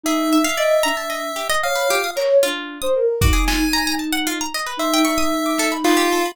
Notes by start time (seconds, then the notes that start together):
0.04 D#4 G#4 E5
0.33 E5
0.44 F5
0.57 D5 D#5
0.83 D4 A#5
0.97 A5
1.10 D#5
1.36 G4
1.50 D#5
1.63 C#5 F5 D#6
1.75 B4
1.88 F4 G4
2.04 D#6
2.16 A#4 C#5, clap
2.43 D4 F4
2.82 C5 D#6
2.95 A#4
3.21 D#4 F#4 D6, kick
3.33 G#4
3.48 F4 G#5, snare
3.73 A#5
3.87 A#5
3.99 A5
4.13 F#5
4.27 F4
4.41 A#5
4.54 D#5
4.66 B4
4.77 D#4 C5 E5
4.94 G5
5.05 C#6, cowbell
5.18 D#6
5.46 D6
5.58 A4, snare
5.72 B5
5.84 F4 B4, clap
5.97 G4
6.12 A4
6.26 B5